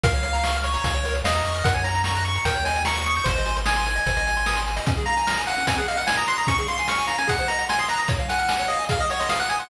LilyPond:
<<
  \new Staff \with { instrumentName = "Lead 1 (square)" } { \time 4/4 \key des \major \tempo 4 = 149 f''4. des''4. ees''4 | ges''16 aes''16 bes''8 bes''16 bes''16 des'''8 g''8 aes''8 des'''8 des'''16 des'''16 | c''4 aes''2~ aes''8 r8 | r8 bes''4 ges''8 aes''16 ges''16 f''16 ges''16 aes''16 bes''16 c'''16 bes''16 |
des'''16 des'''16 c'''16 c'''16 des'''8 bes''16 aes''16 ges''8 bes''8 aes''16 c'''16 bes''16 bes''16 | r8 ges''4 ees''8 f''16 ees''16 des''16 ees''16 f''16 ges''16 aes''16 ges''16 | }
  \new Staff \with { instrumentName = "Lead 1 (square)" } { \time 4/4 \key des \major bes'16 des''16 f''16 bes''16 des'''16 f'''16 des'''16 bes''16 f''16 des''16 bes'16 des''16 f''16 bes''16 des'''16 f'''16 | bes'16 des''16 ges''16 bes''16 des'''16 ges'''16 des'''16 bes''16 bes'16 des''16 ees''16 g''16 bes''16 des'''16 ees'''16 g'''16 | c''16 ees''16 aes''16 c'''16 ees'''16 c'''16 aes''16 ees''16 c''16 ees''16 aes''16 c'''16 ees'''16 c'''16 aes''16 ees''16 | des'16 aes'16 f''16 aes''16 f'''16 aes''16 f''16 des'16 c'16 aes'16 ees''16 ges''16 aes''16 ees'''16 ges'''16 ees'''16 |
des'16 aes'16 f''16 aes''16 f'''16 aes''16 f''16 des'16 aes'16 c''16 ees''16 ges''16 c'''16 ees'''16 ges'''16 ees'''16 | des''16 f''16 aes''16 f'''16 aes''16 des''16 f''16 aes''16 aes'16 ees''16 ges''16 c'''16 ees'''16 ges'''16 ees'''16 c'''16 | }
  \new Staff \with { instrumentName = "Synth Bass 1" } { \clef bass \time 4/4 \key des \major des,2 des,4 e,8 f,8 | ges,2 ees,2 | aes,,2 aes,,2 | r1 |
r1 | r1 | }
  \new DrumStaff \with { instrumentName = "Drums" } \drummode { \time 4/4 <hh bd>16 hh16 hh16 hh16 sn16 hh16 hh16 hh16 <hh bd>16 hh16 hh16 hh16 sn16 hh16 hh16 hh16 | <hh bd>16 hh16 hh16 hh16 sn16 hh16 hh16 hh16 <hh bd>16 hh16 hh16 hh16 sn16 hh16 hh16 hh16 | <hh bd>16 hh16 hh16 hh16 sn16 hh16 hh16 hh16 <hh bd>16 hh16 hh16 hh16 sn16 hh16 hh16 hh16 | <hh bd>16 hh16 hh16 hh16 sn16 hh16 hh16 hh16 <hh bd>16 hh16 hh16 hh16 sn16 hh16 hh16 hh16 |
<hh bd>16 hh16 hh16 hh16 sn16 hh16 hh16 hh16 <hh bd>16 hh16 hh16 hh16 sn16 hh16 hh16 hh16 | <hh bd>16 hh16 hh16 hh16 sn16 hh16 hh16 hh16 <hh bd>16 hh16 hh16 hh16 sn16 hh16 hh16 hh16 | }
>>